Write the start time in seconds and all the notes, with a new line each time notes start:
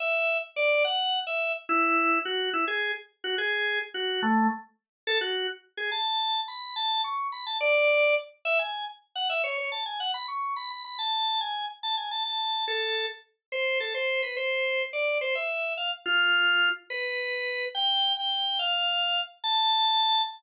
0.00 E5
0.56 D5
0.84 F#5
1.27 E5
1.69 E4
2.25 F#4
2.53 E4
2.68 G#4
3.24 F#4
3.38 G#4
3.94 F#4
4.23 A3
5.07 A4
5.21 F#4
5.77 G#4
5.92 A5
6.48 B5
6.76 A5
7.04 C#6
7.32 B5
7.46 A5
7.61 D5
8.45 E5
8.59 G#5
9.15 F#5
9.30 E5
9.44 C#5
9.58 C#5
9.72 A5
9.86 G#5
10.00 F#5
10.14 B5
10.28 C#6
10.56 B5
10.70 B5
10.85 B5
10.99 A5
11.41 G#5
11.83 A5
11.97 G#5
12.11 A5
12.25 A5
12.68 A4
13.52 C5
13.80 A4
13.94 C5
14.23 B4
14.37 C5
14.93 D5
15.21 C5
15.35 E5
15.77 F5
16.06 F4
16.90 B4
17.75 G5
18.17 G5
18.59 F5
19.44 A5